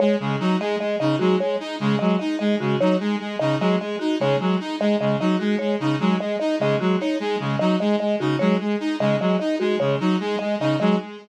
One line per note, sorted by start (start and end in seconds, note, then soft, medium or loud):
0.00 0.16 G#3 medium
0.00 0.16 C#5 medium
0.20 0.36 C#3 medium
0.20 0.36 G#3 medium
0.40 0.56 F#3 medium
0.40 0.56 D#4 medium
0.60 0.76 G#3 medium
0.60 0.77 D#5 medium
0.80 0.96 G#3 medium
0.80 0.96 D#5 medium
1.00 1.16 C#3 medium
1.00 1.16 D#4 medium
1.00 1.16 D#5 medium
1.19 1.36 F#3 medium
1.19 1.36 G#3 medium
1.19 1.35 F#4 medium
1.40 1.56 G#3 medium
1.40 1.56 C#5 medium
1.60 1.76 D#4 medium
1.80 1.96 C#3 medium
1.80 1.96 G#3 medium
1.99 2.16 F#3 medium
1.99 2.16 G#3 medium
1.99 2.15 D#5 medium
2.19 2.36 D#4 medium
2.19 2.35 D#5 medium
2.39 2.56 G#3 medium
2.39 2.55 D#5 medium
2.60 2.76 C#3 medium
2.60 2.76 G#3 medium
2.60 2.76 F#4 medium
2.80 2.96 F#3 medium
2.80 2.96 D#4 medium
2.80 2.97 C#5 medium
3.00 3.16 G#3 medium
3.20 3.36 G#3 medium
3.39 3.56 C#3 medium
3.39 3.56 D#4 medium
3.39 3.55 D#5 medium
3.60 3.76 F#3 medium
3.60 3.76 G#3 medium
3.60 3.77 D#5 medium
3.80 3.96 G#3 medium
3.80 3.97 D#5 medium
3.99 4.16 D#4 medium
3.99 4.15 F#4 medium
4.20 4.36 C#3 medium
4.20 4.36 G#3 medium
4.20 4.37 C#5 medium
4.40 4.56 F#3 medium
4.40 4.56 G#3 medium
4.60 4.76 D#4 medium
4.80 4.96 G#3 medium
4.80 4.97 D#5 medium
5.00 5.16 C#3 medium
5.00 5.16 G#3 medium
5.00 5.17 D#5 medium
5.20 5.36 F#3 medium
5.20 5.36 D#4 medium
5.20 5.37 D#5 medium
5.40 5.56 G#3 medium
5.40 5.56 F#4 medium
5.59 5.76 G#3 medium
5.59 5.75 C#5 medium
5.80 5.96 C#3 medium
5.80 5.96 D#4 medium
6.00 6.16 F#3 medium
6.00 6.16 G#3 medium
6.20 6.36 G#3 medium
6.20 6.36 D#5 medium
6.40 6.56 D#4 medium
6.40 6.56 D#5 medium
6.60 6.76 C#3 medium
6.60 6.76 G#3 medium
6.60 6.77 D#5 medium
6.80 6.96 F#3 medium
6.80 6.96 G#3 medium
6.80 6.96 F#4 medium
7.00 7.16 D#4 medium
7.00 7.18 C#5 medium
7.20 7.36 G#3 medium
7.40 7.56 C#3 medium
7.40 7.56 G#3 medium
7.59 7.76 F#3 medium
7.59 7.76 D#4 medium
7.59 7.75 D#5 medium
7.80 7.96 G#3 medium
7.80 7.96 D#5 medium
8.00 8.16 G#3 medium
8.00 8.16 D#5 medium
8.20 8.36 C#3 medium
8.20 8.36 D#4 medium
8.20 8.36 F#4 medium
8.39 8.56 F#3 medium
8.39 8.56 G#3 medium
8.39 8.55 C#5 medium
8.60 8.76 G#3 medium
8.80 8.96 D#4 medium
9.00 9.16 C#3 medium
9.00 9.16 G#3 medium
9.00 9.16 D#5 medium
9.20 9.36 F#3 medium
9.20 9.36 G#3 medium
9.20 9.37 D#5 medium
9.39 9.56 D#4 medium
9.39 9.55 D#5 medium
9.60 9.76 G#3 medium
9.60 9.76 F#4 medium
9.80 9.96 C#3 medium
9.80 9.96 G#3 medium
9.80 9.96 C#5 medium
10.00 10.16 F#3 medium
10.00 10.16 D#4 medium
10.20 10.36 G#3 medium
10.39 10.56 G#3 medium
10.39 10.55 D#5 medium
10.60 10.76 C#3 medium
10.60 10.76 D#4 medium
10.60 10.77 D#5 medium
10.80 10.96 F#3 medium
10.80 10.96 G#3 medium
10.80 10.96 D#5 medium